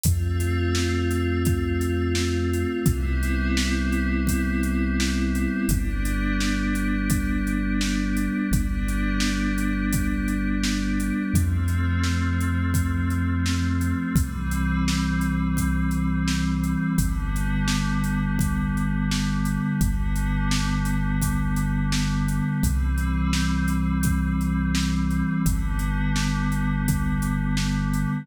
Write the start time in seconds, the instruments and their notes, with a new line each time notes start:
0.04 synth bass 2 F2, pad 5 (bowed) A3 C4 F4, kick, closed hi-hat
0.40 closed hi-hat
0.75 snare
1.11 closed hi-hat
1.45 kick, closed hi-hat
1.81 closed hi-hat
2.15 snare
2.54 closed hi-hat
2.85 synth bass 2 C2, pad 5 (bowed) G3 B3 C4 E4, kick, closed hi-hat
3.23 closed hi-hat
3.57 snare
3.92 closed hi-hat
4.27 kick, closed hi-hat
4.63 closed hi-hat
5.00 snare
5.35 closed hi-hat
5.69 synth bass 2 G1, pad 5 (bowed) G3 B3 D4, kick, closed hi-hat
6.05 closed hi-hat
6.40 snare
6.75 closed hi-hat
7.10 kick, closed hi-hat
7.47 closed hi-hat
7.81 snare
8.17 closed hi-hat
8.51 synth bass 2 G1, pad 5 (bowed) G3 B3 D4, kick, closed hi-hat
8.88 closed hi-hat
9.20 snare
9.58 closed hi-hat
9.93 kick, closed hi-hat
10.28 closed hi-hat
10.64 snare
11.00 closed hi-hat
11.34 synth bass 2 F2, pad 5 (bowed) F3 A3 C4, kick, closed hi-hat
11.68 closed hi-hat
12.04 snare
12.40 closed hi-hat
12.74 kick, closed hi-hat
13.10 closed hi-hat
13.46 snare
13.81 closed hi-hat
14.15 synth bass 2 C2, pad 5 (bowed) E3 G3 C4, kick, closed hi-hat
14.51 closed hi-hat
14.88 snare
15.21 closed hi-hat
15.57 kick, closed hi-hat
15.91 closed hi-hat
16.28 snare
16.64 closed hi-hat
16.98 synth bass 2 G1, pad 5 (bowed) D3 G3 B3, kick, closed hi-hat
17.36 closed hi-hat
17.68 snare
18.04 closed hi-hat
18.39 kick, closed hi-hat
18.77 closed hi-hat
19.11 snare
19.45 closed hi-hat
19.79 synth bass 2 G1, pad 5 (bowed) D3 G3 B3, kick, closed hi-hat
20.16 closed hi-hat
20.51 snare
20.85 closed hi-hat
21.22 kick, closed hi-hat
21.56 closed hi-hat
21.92 snare
22.28 closed hi-hat
22.63 synth bass 2 C2, pad 5 (bowed) E3 G3 C4, kick, closed hi-hat
22.98 closed hi-hat
23.33 snare
23.68 closed hi-hat
24.03 kick, closed hi-hat
24.41 closed hi-hat
24.75 snare
25.11 closed hi-hat
25.45 synth bass 2 G1, pad 5 (bowed) D3 G3 B3, kick, closed hi-hat
25.79 closed hi-hat
26.16 snare
26.52 closed hi-hat
26.88 kick, closed hi-hat
27.22 closed hi-hat
27.57 snare
27.94 closed hi-hat